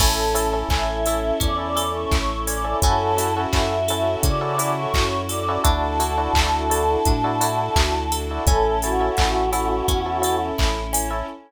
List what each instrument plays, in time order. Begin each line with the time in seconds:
0.00 synth bass 1 A1, electric piano 1 C#4 E4 A4, string ensemble 1 C#4 E4 A4, acoustic guitar (steel) C#4, choir aahs A4, kick, crash
0.34 electric piano 1 C#4 E4 A4, acoustic guitar (steel) A4, open hi-hat
0.53 electric piano 1 C#4 E4 A4
0.69 synth bass 1 A1, acoustic guitar (steel) C#4, electric piano 1 C#4 E4 A4, choir aahs E5, kick, clap
1.06 electric piano 1 C#4 E4 A4, acoustic guitar (steel) E4, open hi-hat
1.40 synth bass 1 E2, acoustic guitar (steel) C#4, choir aahs D5, kick, closed hi-hat
1.57 electric piano 1 C#4 E4 A4, choir aahs D5
1.76 electric piano 1 C#4 E4 A4, acoustic guitar (steel) A4, open hi-hat
1.94 choir aahs C#5
2.11 synth bass 1 A1, acoustic guitar (steel) E4, choir aahs C#5, kick, clap
2.47 acoustic guitar (steel) C#4, choir aahs D5, open hi-hat
2.64 electric piano 1 C#4 E4 A4
2.82 synth bass 1 F#2, string ensemble 1 C#4 E4 F#4 A4, acoustic guitar (steel) C#4, electric piano 1 C#4 E4 F#4 A4, choir aahs A4, kick, closed hi-hat
3.17 electric piano 1 C#4 E4 F#4 A4, acoustic guitar (steel) E4, open hi-hat
3.37 electric piano 1 C#4 E4 F#4 A4
3.53 synth bass 1 F#2, electric piano 1 C#4 E4 F#4 A4, acoustic guitar (steel) F#4, choir aahs E5, kick, clap
3.88 electric piano 1 C#4 E4 F#4 A4, acoustic guitar (steel) A4, open hi-hat
4.23 synth bass 1 C#3, acoustic guitar (steel) C#4, choir aahs D5, kick, closed hi-hat
4.41 electric piano 1 C#4 E4 F#4 A4, choir aahs D5
4.58 electric piano 1 C#4 E4 F#4 A4, acoustic guitar (steel) E4, open hi-hat
4.77 choir aahs C#5
4.94 synth bass 1 F#2, acoustic guitar (steel) F#4, choir aahs C#5, kick, clap
5.29 acoustic guitar (steel) A4, choir aahs D5, open hi-hat
5.48 electric piano 1 C#4 E4 F#4 A4
5.64 synth bass 1 D2, electric piano 1 D4 E4 F#4 A4, acoustic guitar (steel) D4, string ensemble 1 D4 E4 F#4 A4, choir aahs A5, kick, closed hi-hat
5.99 electric piano 1 D4 E4 F#4 A4, acoustic guitar (steel) E4, open hi-hat
6.18 electric piano 1 D4 E4 F#4 A4
6.33 synth bass 1 D2, electric piano 1 D4 E4 F#4 A4, acoustic guitar (steel) F#4, kick, clap
6.70 electric piano 1 D4 E4 F#4 A4, acoustic guitar (steel) A4, open hi-hat
7.05 synth bass 1 A2, acoustic guitar (steel) D4, kick, closed hi-hat
7.24 electric piano 1 D4 E4 F#4 A4
7.41 electric piano 1 D4 E4 F#4 A4, acoustic guitar (steel) E4, open hi-hat
7.76 synth bass 1 D2, acoustic guitar (steel) F#4, kick, clap
8.12 acoustic guitar (steel) A4, open hi-hat
8.31 electric piano 1 D4 E4 F#4 A4
8.46 synth bass 1 A1, string ensemble 1 C#4 E4 A4, acoustic guitar (steel) C#4, electric piano 1 C#4 E4 A4, choir aahs A4, kick, closed hi-hat
8.82 electric piano 1 C#4 E4 A4, choir aahs F#4, acoustic guitar (steel) A4, open hi-hat
9.00 electric piano 1 C#4 E4 A4
9.17 synth bass 1 A1, acoustic guitar (steel) C#4, electric piano 1 C#4 E4 A4, kick, clap
9.52 electric piano 1 C#4 E4 A4, acoustic guitar (steel) E4, open hi-hat
9.88 synth bass 1 E2, acoustic guitar (steel) C#4, kick, closed hi-hat
10.06 electric piano 1 C#4 E4 A4
10.22 electric piano 1 C#4 E4 A4, acoustic guitar (steel) A4, open hi-hat
10.58 synth bass 1 A1, acoustic guitar (steel) E4, kick, clap
10.93 acoustic guitar (steel) C#4, open hi-hat
11.10 electric piano 1 C#4 E4 A4